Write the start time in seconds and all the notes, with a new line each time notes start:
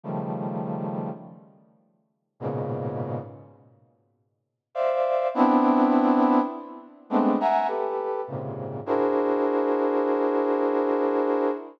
0.03 C#3 D#3 F3 G3 A3
2.40 G#2 A#2 B2 C#3
4.75 C5 D5 E5 F5
5.34 B3 C4 D4 E4
7.10 G#3 A3 B3 C4 D4
7.40 E5 F#5 G#5 A#5
7.67 G4 A4 B4
8.27 G#2 A#2 C3 C#3
8.86 D4 E4 F#4 G#4 A#4 C5